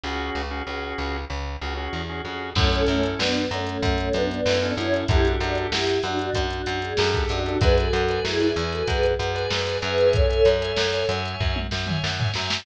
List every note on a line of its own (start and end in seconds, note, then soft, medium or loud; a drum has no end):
0.04 0.30 C#2 medium
0.04 0.42 C#4 medium
0.04 0.42 F#4 medium
0.04 0.42 G#4 medium
0.35 0.62 C#2 medium
0.51 0.63 C#4 medium
0.51 0.63 F#4 medium
0.51 0.63 G#4 medium
0.67 0.94 C#2 medium
0.67 1.17 C#4 medium
0.67 1.17 F#4 medium
0.67 1.17 G#4 medium
0.98 1.25 C#2 medium
1.30 1.57 C#2 medium
1.61 1.88 C#2 medium
1.61 1.74 C#4 medium
1.61 1.74 F#4 medium
1.61 1.74 G#4 medium
1.77 2.02 C#4 medium
1.77 2.02 F#4 medium
1.77 2.02 G#4 medium
1.93 2.21 E2 medium
2.09 2.22 C#4 medium
2.09 2.22 F#4 medium
2.09 2.22 G#4 medium
2.25 2.53 F2 medium
2.25 2.50 C#4 medium
2.25 2.50 F#4 medium
2.25 2.50 G#4 medium
2.55 2.83 F#2 loud
2.55 2.70 A3 medium
2.55 2.69 C#4 medium
2.55 2.70 C#4 loud
2.55 2.69 E4 medium
2.55 2.69 A4 medium
2.55 kick loud
2.55 crash loud
2.70 2.85 A3 medium
2.70 2.85 C#4 loud
2.70 3.22 C#4 medium
2.70 3.22 E4 medium
2.70 3.22 A4 medium
2.70 closed hi-hat medium
2.87 3.15 F#2 medium
2.87 3.02 A3 medium
2.87 3.02 C#4 medium
2.87 closed hi-hat medium
3.03 closed hi-hat medium
3.18 3.46 F#2 medium
3.18 3.44 B3 medium
3.18 3.44 D4 medium
3.18 snare loud
3.35 closed hi-hat medium
3.51 3.78 F#2 medium
3.51 3.66 A3 medium
3.51 3.66 C#4 medium
3.51 closed hi-hat medium
3.67 3.97 A3 medium
3.67 3.97 C#4 medium
3.67 closed hi-hat medium
3.83 4.09 F#2 medium
3.83 kick medium
3.83 closed hi-hat medium
3.98 4.13 A3 medium
3.98 4.13 C#4 loud
3.98 closed hi-hat medium
4.13 4.41 F#2 medium
4.13 4.28 B3 medium
4.13 4.28 D4 medium
4.13 closed hi-hat medium
4.31 4.73 B3 medium
4.31 4.73 D4 medium
4.31 closed hi-hat medium
4.46 4.73 F#2 medium
4.46 4.59 C#4 medium
4.46 4.59 E4 medium
4.46 4.59 A4 medium
4.46 snare loud
4.62 4.87 C#4 medium
4.62 4.87 E4 medium
4.62 4.87 A4 medium
4.62 closed hi-hat medium
4.77 5.04 F#2 medium
4.77 5.05 C#4 medium
4.77 5.05 E4 loud
4.77 closed hi-hat medium
4.93 5.05 C#4 medium
4.93 5.05 E4 medium
4.93 5.05 A4 medium
4.93 closed hi-hat medium
5.08 5.36 F#2 medium
5.08 5.22 D4 medium
5.08 5.25 E4 loud
5.08 5.22 G4 medium
5.08 5.25 G4 loud
5.08 5.22 A4 medium
5.08 kick loud
5.08 closed hi-hat loud
5.24 5.39 D4 medium
5.24 5.75 D4 medium
5.24 5.39 F#4 medium
5.24 5.75 G4 medium
5.24 5.75 A4 medium
5.24 closed hi-hat medium
5.40 5.67 F#2 medium
5.40 5.55 D4 medium
5.40 5.55 F#4 medium
5.40 closed hi-hat medium
5.55 closed hi-hat medium
5.72 5.99 F#2 medium
5.72 5.99 E4 medium
5.72 5.99 G4 loud
5.72 snare loud
5.87 closed hi-hat medium
6.03 6.30 F#2 medium
6.03 6.18 D4 medium
6.03 6.18 F#4 medium
6.03 closed hi-hat medium
6.19 6.46 D4 medium
6.19 6.46 F#4 loud
6.19 closed hi-hat medium
6.34 6.62 F#2 medium
6.34 kick medium
6.34 closed hi-hat loud
6.50 6.66 D4 medium
6.50 6.66 F#4 medium
6.50 closed hi-hat medium
6.66 6.94 F#2 medium
6.66 6.81 D4 medium
6.66 6.81 F#4 loud
6.66 closed hi-hat medium
6.81 7.22 G#4 loud
6.81 closed hi-hat medium
6.97 7.25 F#2 loud
6.97 7.11 D4 medium
6.97 7.11 G4 medium
6.97 7.11 A4 medium
6.97 snare loud
7.14 7.40 D4 medium
7.14 7.40 G4 medium
7.14 7.40 A4 medium
7.14 kick medium
7.14 closed hi-hat medium
7.29 7.57 F#2 medium
7.29 7.58 D4 medium
7.29 7.58 F#4 loud
7.29 closed hi-hat medium
7.46 7.59 D4 medium
7.46 7.59 G4 medium
7.46 7.59 A4 medium
7.46 closed hi-hat medium
7.61 7.88 F#2 loud
7.61 7.77 G#4 loud
7.61 7.75 B4 medium
7.61 7.77 B4 loud
7.61 7.75 D5 medium
7.61 7.75 G#5 medium
7.61 kick loud
7.61 closed hi-hat loud
7.77 8.21 F#4 medium
7.77 8.21 A4 loud
7.77 8.02 B4 medium
7.77 8.02 D5 medium
7.77 8.02 G#5 medium
7.77 closed hi-hat medium
7.93 8.20 F#2 medium
7.93 closed hi-hat medium
8.09 8.35 B4 medium
8.09 8.35 D5 medium
8.09 8.35 G#5 medium
8.09 closed hi-hat medium
8.24 8.51 F#2 medium
8.24 8.63 E4 medium
8.24 8.63 G#4 medium
8.24 snare medium
8.40 8.53 B4 medium
8.40 8.53 D5 medium
8.40 8.53 G#5 medium
8.40 closed hi-hat medium
8.56 8.83 E2 medium
8.56 9.07 B4 medium
8.56 9.07 D5 medium
8.56 9.07 G#5 medium
8.56 closed hi-hat medium
8.72 8.87 F#4 medium
8.72 8.87 A4 medium
8.72 closed hi-hat medium
8.88 9.15 F#2 medium
8.88 9.70 G#4 medium
8.88 9.70 B4 medium
8.88 kick medium
8.88 closed hi-hat loud
9.03 closed hi-hat medium
9.19 9.46 F#2 medium
9.19 closed hi-hat medium
9.35 9.60 B4 medium
9.35 9.60 D5 medium
9.35 9.60 G#5 medium
9.35 closed hi-hat medium
9.51 9.78 F#2 medium
9.51 snare loud
9.67 9.80 B4 medium
9.67 9.80 D5 medium
9.67 9.80 G#5 medium
9.67 closed hi-hat medium
9.82 10.41 F#2 loud
9.82 10.08 G#4 medium
9.82 10.08 B4 loud
9.82 10.26 C#5 medium
9.82 10.26 E5 medium
9.82 10.26 G#5 medium
9.82 closed hi-hat medium
9.98 closed hi-hat medium
10.13 11.06 A4 loud
10.13 11.06 C#5 loud
10.13 kick loud
10.13 closed hi-hat loud
10.29 10.55 C#5 medium
10.29 10.55 E5 medium
10.29 10.55 G#5 medium
10.29 closed hi-hat medium
10.45 10.73 F#2 medium
10.45 closed hi-hat medium
10.62 10.87 C#5 medium
10.62 10.87 E5 medium
10.62 10.87 G#5 medium
10.62 closed hi-hat medium
10.76 11.04 F#2 medium
10.76 snare loud
10.93 11.06 C#5 medium
10.93 11.06 E5 medium
10.93 11.06 G#5 medium
10.93 closed hi-hat medium
11.09 11.36 F#2 medium
11.09 11.60 C#5 medium
11.09 11.60 E5 medium
11.09 11.60 G#5 medium
11.09 closed hi-hat medium
11.26 closed hi-hat medium
11.40 11.67 F#2 medium
11.40 kick medium
11.56 high tom medium
11.71 11.99 F#2 medium
11.71 snare medium
11.87 12.13 C#5 medium
11.87 12.13 E5 medium
11.87 12.13 G#5 medium
11.87 mid tom medium
12.04 12.31 F#2 medium
12.04 snare medium
12.19 12.32 C#5 medium
12.19 12.32 E5 medium
12.19 12.32 G#5 medium
12.19 floor tom loud
12.34 12.62 F#2 medium
12.34 12.61 C#5 medium
12.34 12.61 E5 medium
12.34 12.61 G#5 medium
12.34 snare medium
12.50 snare loud